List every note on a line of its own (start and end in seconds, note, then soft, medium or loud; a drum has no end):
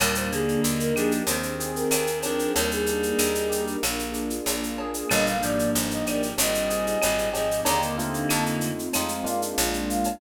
0.00 0.57 D#2 loud
0.00 0.30 A#2 medium
0.00 0.30 G3 medium
0.00 0.62 A#3 medium
0.00 1.21 A#3 medium
0.00 0.62 D4 medium
0.00 0.62 D#4 medium
0.00 0.62 G4 medium
0.00 0.15 A#4 medium
0.00 cowbell medium
0.00 claves medium
0.00 shaker medium
0.15 0.31 C5 medium
0.15 shaker medium
0.31 0.92 D3 medium
0.31 0.92 A#3 medium
0.31 1.23 D4 medium
0.31 0.61 G#4 medium
0.31 shaker medium
0.48 shaker soft
0.62 1.22 D#2 medium
0.62 1.27 A#3 medium
0.62 1.27 D4 medium
0.62 1.23 D#4 medium
0.62 1.26 G4 medium
0.62 1.27 A#4 medium
0.62 shaker medium
0.80 0.95 A#4 medium
0.80 shaker medium
0.96 1.23 F3 medium
0.96 1.23 D4 medium
0.96 1.26 G4 medium
0.96 1.11 G#4 medium
0.96 claves medium
0.96 shaker medium
1.11 shaker medium
1.27 1.84 D#2 medium
1.27 1.89 D#3 medium
1.27 1.90 C4 medium
1.27 1.89 C4 medium
1.27 1.91 C4 medium
1.27 1.90 D#4 medium
1.27 1.90 G4 medium
1.27 1.90 G#4 medium
1.27 1.69 C5 medium
1.27 cowbell medium
1.27 shaker medium
1.43 shaker medium
1.60 2.51 G#4 medium
1.60 shaker medium
1.76 2.18 A#4 medium
1.76 shaker medium
1.91 2.48 D#2 medium
1.91 2.23 D#3 medium
1.91 2.54 C4 medium
1.91 2.52 C4 medium
1.91 2.23 C4 medium
1.91 2.54 D#4 medium
1.91 2.54 G#4 medium
1.91 2.54 C5 medium
1.91 cowbell medium
1.91 claves medium
1.91 shaker medium
2.07 shaker medium
2.22 2.52 F3 medium
2.22 2.52 D4 medium
2.22 2.55 G4 medium
2.22 2.51 A#4 medium
2.22 cowbell medium
2.22 shaker medium
2.39 shaker medium
2.54 3.13 D#2 medium
2.54 3.76 G3 medium
2.54 3.76 A#3 medium
2.54 3.18 A#3 medium
2.54 3.18 D4 medium
2.54 3.18 D#4 medium
2.54 3.76 D#4 medium
2.54 3.18 G4 medium
2.54 2.70 A#4 medium
2.54 cowbell medium
2.54 shaker medium
2.71 3.63 G#4 medium
2.71 shaker medium
2.86 3.78 D4 medium
2.86 shaker medium
3.03 shaker medium
3.18 3.76 D#2 medium
3.18 3.83 A#3 medium
3.18 3.83 D4 medium
3.18 3.80 D#4 medium
3.18 3.83 G4 medium
3.18 3.83 A#4 medium
3.18 claves medium
3.18 shaker medium
3.35 shaker medium
3.49 3.80 G4 medium
3.49 shaker medium
3.67 shaker medium
3.83 4.40 A#1 medium
3.83 5.04 A#3 medium
3.83 4.47 A#3 medium
3.83 4.47 D4 medium
3.83 4.47 F4 medium
3.83 4.47 G#4 medium
3.83 cowbell medium
3.83 claves medium
3.83 shaker medium
3.99 shaker medium
4.13 5.04 D4 medium
4.13 shaker medium
4.30 shaker medium
4.46 5.03 A#1 medium
4.46 5.10 A#3 medium
4.46 5.10 D4 medium
4.46 5.07 F4 medium
4.46 5.11 G#4 medium
4.46 5.11 A#4 medium
4.46 cowbell medium
4.46 shaker medium
4.63 shaker medium
4.78 5.10 G#4 medium
4.78 cowbell medium
4.94 shaker medium
5.10 5.69 G1 loud
5.10 5.36 A#2 medium
5.10 5.36 G3 medium
5.10 5.74 A#3 medium
5.10 6.32 A#3 medium
5.10 5.74 D4 medium
5.10 5.74 D#4 medium
5.10 5.74 G4 medium
5.10 5.25 D#5 medium
5.10 cowbell medium
5.10 claves medium
5.10 shaker medium
5.26 5.43 F5 medium
5.26 shaker medium
5.42 6.02 G#2 medium
5.42 6.02 F3 medium
5.42 6.33 D4 medium
5.42 5.70 D5 medium
5.42 shaker medium
5.59 shaker medium
5.74 6.33 G1 medium
5.74 6.38 A#3 medium
5.74 6.38 D4 medium
5.74 6.35 D#4 medium
5.74 6.37 G4 medium
5.74 6.38 A#4 medium
5.74 shaker medium
5.90 6.05 D#5 medium
5.90 shaker medium
6.05 6.34 G#2 medium
6.05 6.34 F3 medium
6.05 6.36 G4 medium
6.05 6.22 D5 medium
6.05 claves medium
6.05 shaker medium
6.23 shaker medium
6.37 6.96 G#1 medium
6.37 6.98 A#2 medium
6.37 6.98 G3 medium
6.37 7.00 C4 medium
6.37 7.02 C4 medium
6.37 7.00 D#4 medium
6.37 7.00 G4 medium
6.37 7.00 G#4 medium
6.37 6.86 D#5 medium
6.37 cowbell medium
6.37 shaker loud
6.54 shaker medium
6.69 7.60 G#4 medium
6.69 shaker medium
6.86 7.29 D#5 medium
6.86 shaker medium
7.02 7.61 G#1 medium
7.02 7.30 A#2 medium
7.02 7.30 G3 medium
7.02 7.63 C4 medium
7.02 7.66 C4 medium
7.02 7.66 D#4 medium
7.02 7.66 G#4 medium
7.02 7.66 C5 medium
7.02 cowbell medium
7.02 claves medium
7.02 shaker medium
7.18 shaker medium
7.33 7.64 G#2 medium
7.33 7.64 F3 medium
7.33 7.63 G4 medium
7.33 7.61 D#5 medium
7.33 cowbell medium
7.33 shaker medium
7.51 shaker medium
7.65 8.25 D#2 medium
7.65 8.71 D3 medium
7.65 7.95 A#3 medium
7.65 8.29 A#3 medium
7.65 8.71 A#3 medium
7.65 7.95 D4 medium
7.65 8.29 D4 medium
7.65 7.95 D#4 medium
7.65 8.29 D#4 medium
7.65 7.95 G4 medium
7.65 8.29 G4 medium
7.65 7.81 A#5 medium
7.65 cowbell medium
7.65 shaker medium
7.82 shaker medium
7.98 8.87 A3 medium
7.98 8.87 C4 medium
7.98 8.87 D#4 medium
7.98 8.87 F4 medium
7.98 shaker medium
8.14 shaker medium
8.29 8.89 F2 medium
8.29 8.93 A3 medium
8.29 8.93 C4 medium
8.29 8.93 D#4 medium
8.29 8.93 F4 medium
8.29 8.44 A5 medium
8.29 claves medium
8.29 shaker medium
8.46 shaker medium
8.61 shaker medium
8.79 shaker medium
8.93 9.54 F2 medium
8.93 9.57 G#3 medium
8.93 9.24 G#3 medium
8.93 9.57 C4 medium
8.93 9.25 C4 medium
8.93 9.57 D#4 medium
8.93 9.25 D#4 medium
8.93 9.57 F4 medium
8.93 9.24 F4 medium
8.93 cowbell medium
8.93 claves medium
8.93 shaker medium
9.09 shaker medium
9.24 10.13 G#3 medium
9.24 10.13 A#3 medium
9.24 10.13 D4 medium
9.24 10.13 F4 medium
9.24 9.41 F5 medium
9.24 shaker medium
9.42 shaker medium
9.57 10.16 A#1 loud
9.57 10.20 G#3 medium
9.57 10.20 A#3 medium
9.57 10.20 D4 medium
9.57 10.20 F4 medium
9.57 cowbell medium
9.57 shaker medium
9.73 shaker medium
9.89 10.16 F5 medium
9.89 shaker medium
10.04 cowbell medium
10.04 shaker medium